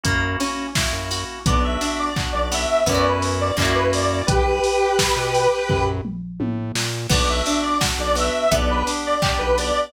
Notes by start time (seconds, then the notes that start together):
0.04 F#2 A#3 C#4 E4 F#4, kick, closed hi-hat
0.40 C#4, open hi-hat
0.75 A#3 C#4 E4 F#4, kick, snare
0.93 F#2
1.11 F#4, open hi-hat
1.46 B1 B3 D4 F#4 D5, kick, closed hi-hat
1.64 E5
1.81 D4, open hi-hat
1.99 D5
2.16 B3 D4 F#4, kick, clap
2.32 B1 D5
2.52 B3 E5, open hi-hat
2.86 F#2 B3 C#4 E4 F#4 D5, kick, closed hi-hat
2.92 E4 F#4
3.05 B4
3.22 open hi-hat
3.40 D5
3.57 F#2 A#3 C#4 E4 F#4 D5, kick, clap
3.62 E4 F#4
3.74 B4
3.92 D5, open hi-hat
4.26 B1 G4 B4, kick, closed hi-hat
4.64 open hi-hat
4.99 kick, snare
5.16 B2
5.34 open hi-hat
5.69 F#2, kick, floor tom
6.05 mid tom
6.40 A2, high tom
6.75 A#2, snare
7.09 B1 B3 D4 F#4 D5, kick, crash
7.29 E5
7.46 D4, open hi-hat
7.62 D5
7.81 B3 D4 F#4, kick, snare
7.98 B1 D5
8.15 B3 E5, open hi-hat
8.51 B1 B3 D4 G4 D5, kick, closed hi-hat
8.70 B4
8.87 D4, open hi-hat
9.05 D5
9.22 B3 D4 G4 D5, kick, clap
9.38 B1 B4
9.57 B3 D5, open hi-hat